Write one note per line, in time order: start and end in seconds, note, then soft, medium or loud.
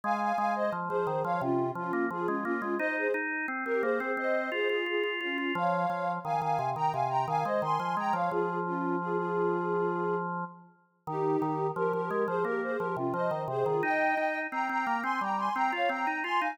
0.04 0.32 G#3 medium
0.04 0.20 F5 medium
0.04 0.20 G#5 medium
0.21 0.37 F5 medium
0.21 0.37 G#5 medium
0.37 0.70 G#3 medium
0.37 0.54 F5 medium
0.37 0.54 G#5 medium
0.55 0.72 C5 medium
0.55 0.72 D#5 medium
0.72 0.89 F3 medium
0.89 1.06 F3 medium
0.89 1.22 G#4 medium
0.89 1.22 C5 medium
1.07 1.23 D#3 medium
1.24 1.41 F3 medium
1.24 1.41 C#5 medium
1.24 1.41 F5 medium
1.41 1.71 C3 medium
1.41 1.70 C#4 medium
1.41 1.70 F4 medium
1.75 1.92 F3 medium
1.75 2.05 C#4 medium
1.75 2.05 F4 medium
1.93 2.09 A#3 medium
2.10 2.27 F3 medium
2.10 2.27 F4 medium
2.10 2.28 G#4 medium
2.27 2.44 G#3 medium
2.27 2.44 C#4 medium
2.27 2.44 F4 medium
2.44 2.61 A#3 medium
2.44 2.75 C#4 medium
2.44 2.75 F4 medium
2.62 2.78 G#3 medium
2.79 3.07 D#4 medium
2.79 2.95 C5 medium
2.79 2.95 D#5 medium
2.97 3.13 G#4 medium
2.97 3.13 C5 medium
3.14 3.46 D#4 medium
3.48 3.64 C4 medium
3.65 3.82 C4 medium
3.65 3.82 G4 medium
3.65 3.82 A#4 medium
3.82 3.99 A#3 medium
3.82 4.12 G#4 medium
3.82 4.12 C5 medium
4.00 4.17 C4 medium
4.17 4.50 C4 medium
4.17 4.49 C5 medium
4.17 4.49 D#5 medium
4.52 4.68 F4 medium
4.52 4.67 G#4 medium
4.52 4.68 C5 medium
4.68 4.84 F4 medium
4.68 4.86 F4 medium
4.68 4.84 G#4 medium
4.86 5.03 F4 medium
4.86 5.15 F4 medium
4.86 5.15 G#4 medium
5.03 5.20 F4 medium
5.20 5.52 C#4 medium
5.20 5.52 F4 medium
5.20 5.37 F4 medium
5.38 5.54 F4 medium
5.55 5.86 F3 loud
5.55 6.11 C#5 medium
5.55 6.11 F5 medium
5.90 6.19 F3 medium
6.25 6.41 D#3 medium
6.25 6.41 F5 medium
6.25 6.41 G#5 medium
6.41 6.58 D#3 medium
6.41 6.69 F5 medium
6.41 6.69 G#5 medium
6.59 6.75 C3 medium
6.76 6.92 D#3 medium
6.76 6.92 G5 medium
6.76 6.92 A#5 medium
6.92 7.26 C3 medium
6.92 7.09 F5 medium
6.92 7.09 G#5 medium
7.09 7.26 G5 medium
7.09 7.26 A#5 medium
7.28 7.44 D#3 medium
7.28 7.44 F5 medium
7.28 7.44 G#5 medium
7.44 7.62 G#3 medium
7.44 7.61 C5 medium
7.44 7.61 D#5 medium
7.62 7.78 D#3 medium
7.62 7.95 G#5 medium
7.62 7.95 C6 medium
7.79 7.96 F3 medium
7.97 8.13 G#3 medium
7.97 8.14 G5 medium
7.97 8.14 A#5 medium
8.13 8.30 F3 medium
8.13 8.30 C#5 medium
8.13 8.30 F5 medium
8.31 10.44 F3 medium
8.31 8.59 F4 medium
8.31 8.59 G#4 medium
8.66 8.96 C#4 medium
8.66 8.96 F4 medium
9.00 9.17 F4 medium
9.00 9.17 G#4 medium
9.17 10.16 F4 medium
9.17 10.16 G#4 medium
11.07 11.37 D#3 medium
11.07 11.67 D#4 medium
11.07 11.67 G4 medium
11.42 11.71 D#3 medium
11.76 11.92 F3 medium
11.76 11.92 G4 medium
11.76 11.92 A#4 medium
11.93 12.10 F3 medium
11.93 12.24 G4 medium
11.93 12.24 A#4 medium
12.10 12.27 G#3 medium
12.27 12.44 F3 medium
12.27 12.43 G#4 medium
12.27 12.43 C5 medium
12.44 12.77 A#3 medium
12.44 12.61 G4 medium
12.44 12.61 A#4 medium
12.63 12.79 G#4 medium
12.63 12.79 C5 medium
12.78 12.96 F3 medium
12.78 12.94 G4 medium
12.78 12.94 A#4 medium
12.96 13.13 C3 medium
12.96 13.13 C#4 medium
12.96 13.13 F4 medium
13.14 13.30 F3 medium
13.14 13.43 C5 medium
13.14 13.43 D#5 medium
13.31 13.47 D#3 medium
13.48 13.64 C3 medium
13.48 13.65 G#4 medium
13.48 13.65 C5 medium
13.65 13.82 D#3 medium
13.65 13.81 F4 medium
13.65 13.81 G#4 medium
13.83 14.15 D#4 loud
13.83 14.39 D#5 medium
13.83 14.39 G5 medium
14.17 14.47 D#4 medium
14.51 14.68 C4 medium
14.51 14.68 G5 medium
14.51 14.68 A#5 medium
14.69 14.86 C4 medium
14.69 15.01 G5 medium
14.69 15.01 A#5 medium
14.87 15.03 A#3 medium
15.03 15.20 C4 medium
15.03 15.20 G#5 medium
15.03 15.20 C6 medium
15.21 15.49 G3 medium
15.21 15.38 G5 medium
15.21 15.38 A#5 medium
15.37 15.54 G#5 medium
15.37 15.54 C6 medium
15.55 15.72 C4 medium
15.55 15.71 G5 medium
15.55 15.71 A#5 medium
15.72 15.89 F4 medium
15.72 15.89 C#5 medium
15.72 15.89 F5 medium
15.89 16.06 C4 medium
15.89 16.19 G5 medium
15.89 16.19 A#5 medium
16.07 16.23 D#4 medium
16.23 16.40 F4 medium
16.23 16.40 G#5 medium
16.23 16.40 C6 medium
16.40 16.58 D#4 medium
16.40 16.56 F5 medium
16.40 16.56 G#5 medium